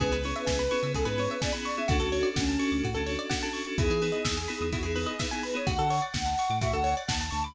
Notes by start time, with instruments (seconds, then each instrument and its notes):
0.00 synth bass 1 C#2, electric piano 2 B3 C#4 E4 G#4, pizzicato strings G#4, ocarina B4, kick, closed hi-hat
0.12 synth bass 1 C#2, pizzicato strings B4, closed hi-hat
0.24 electric piano 2 B3 C#4 E4 G#4, pizzicato strings C#5, open hi-hat
0.35 pizzicato strings E5, closed hi-hat
0.46 synth bass 1 C#2, pizzicato strings G#5, kick, snare
0.59 pizzicato strings B5, closed hi-hat
0.71 electric piano 2 B3 C#4 E4 G#4, pizzicato strings C#6, open hi-hat
0.83 synth bass 1 C#3, pizzicato strings E6, closed hi-hat
0.94 synth bass 1 C#2, pizzicato strings G#4, ocarina A4, kick, closed hi-hat
1.05 synth bass 1 G#2, electric piano 2 B3 C#4 E4 G#4, pizzicato strings B4, ocarina B4, closed hi-hat
1.17 electric piano 2 B3 C#4 E4 G#4, pizzicato strings C#5, open hi-hat
1.30 ocarina B4, pizzicato strings E5, closed hi-hat
1.41 electric piano 2 B3 C#4 E4 G#4, ocarina D5, pizzicato strings G#5, kick, snare
1.53 electric piano 2 B3 C#4 E4 G#4, pizzicato strings B5, closed hi-hat
1.65 ocarina D5, pizzicato strings C#6, open hi-hat
1.77 electric piano 2 B3 C#4 E4 G#4, ocarina E5, pizzicato strings E6, closed hi-hat
1.88 synth bass 1 D2, electric piano 2 C#4 D4 F#4 A4, pizzicato strings F#4, ocarina F#4, kick, closed hi-hat
2.00 synth bass 1 D2, pizzicato strings A4, closed hi-hat
2.12 electric piano 2 C#4 D4 F#4 A4, pizzicato strings C#5, open hi-hat
2.23 pizzicato strings D5, closed hi-hat
2.36 synth bass 1 D2, ocarina C#4, pizzicato strings F#5, kick, snare
2.48 pizzicato strings A5, closed hi-hat
2.59 electric piano 2 C#4 D4 F#4 A4, pizzicato strings C#6, open hi-hat
2.72 synth bass 1 D2, pizzicato strings D6
2.83 synth bass 1 A2, pizzicato strings F#4, kick, closed hi-hat
2.94 synth bass 1 D2, electric piano 2 C#4 D4 F#4 A4, pizzicato strings A4, closed hi-hat
3.06 electric piano 2 C#4 D4 F#4 A4, pizzicato strings C#5, open hi-hat
3.19 pizzicato strings D5, closed hi-hat
3.30 electric piano 2 C#4 D4 F#4 A4, pizzicato strings F#5, kick, snare
3.43 electric piano 2 C#4 D4 F#4 A4, pizzicato strings A5, closed hi-hat
3.53 pizzicato strings C#6, open hi-hat
3.65 electric piano 2 C#4 D4 F#4 A4, pizzicato strings D6, closed hi-hat
3.78 synth bass 1 E2, electric piano 2 B3 D#4 E4 G#4, pizzicato strings E4, ocarina G#4, kick, closed hi-hat
3.90 synth bass 1 E3, pizzicato strings G#4, closed hi-hat
4.01 electric piano 2 B3 D#4 E4 G#4, pizzicato strings B4, open hi-hat
4.12 pizzicato strings D#5, closed hi-hat
4.25 synth bass 1 E2, pizzicato strings E5, kick, snare
4.37 pizzicato strings G#5, closed hi-hat
4.48 electric piano 2 B3 D#4 E4 G#4, pizzicato strings B5, open hi-hat
4.61 synth bass 1 E2, pizzicato strings D#6, closed hi-hat
4.72 synth bass 1 E2, pizzicato strings E4, ocarina F#4, kick, closed hi-hat
4.83 synth bass 1 E2, electric piano 2 B3 D#4 E4 G#4, pizzicato strings G#4, ocarina G#4, closed hi-hat
4.96 electric piano 2 B3 D#4 E4 G#4, pizzicato strings B4, open hi-hat
5.06 ocarina G#4, pizzicato strings D#5, closed hi-hat
5.19 electric piano 2 B3 D#4 E4 G#4, ocarina B4, pizzicato strings E5, kick, snare
5.31 electric piano 2 B3 D#4 E4 G#4, pizzicato strings G#5, closed hi-hat
5.43 ocarina B4, pizzicato strings B5, open hi-hat
5.54 electric piano 2 B3 D#4 E4 G#4, ocarina C#5, pizzicato strings D#6, closed hi-hat
5.67 synth bass 1 D2, pizzicato strings F#4, ocarina F#5, kick, closed hi-hat
5.79 synth bass 1 D3, pizzicato strings A4, closed hi-hat
5.90 pizzicato strings C#5, open hi-hat
6.02 pizzicato strings D5, closed hi-hat
6.14 synth bass 1 D2, pizzicato strings F#5, kick, snare
6.26 pizzicato strings A5, closed hi-hat
6.38 pizzicato strings C#6, open hi-hat
6.50 synth bass 1 A2, pizzicato strings D6, closed hi-hat
6.61 synth bass 1 A2, pizzicato strings F#4, ocarina E5, kick, closed hi-hat
6.73 synth bass 1 D2, pizzicato strings A4, ocarina F#5, closed hi-hat
6.84 pizzicato strings C#5, open hi-hat
6.97 pizzicato strings D5, ocarina F#5, closed hi-hat
7.08 synth bass 1 D#2, pizzicato strings F#5, ocarina A5, kick, snare
7.20 pizzicato strings A5, closed hi-hat
7.31 synth bass 1 D2, ocarina A5, pizzicato strings C#6, open hi-hat
7.44 ocarina B5, pizzicato strings D6, closed hi-hat